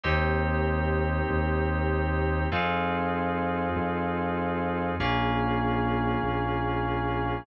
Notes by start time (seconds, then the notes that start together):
0.03 D#2 A#3 C4 D#4 G4
1.30 D#2
2.52 F2 C4 D#4 F4 G#4
3.76 F2
5.00 A#1 A#3 C#4 F4 G#4
6.23 A#1